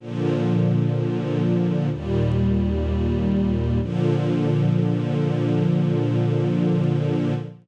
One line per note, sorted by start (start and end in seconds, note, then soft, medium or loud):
0.00 1.89 A#2 loud
0.00 1.89 D3 medium
0.00 1.89 F3 medium
1.90 3.79 D#2 medium
1.90 3.79 A#2 medium
1.90 3.79 G3 medium
3.81 7.34 A#2 loud
3.81 7.34 D3 loud
3.81 7.34 F3 loud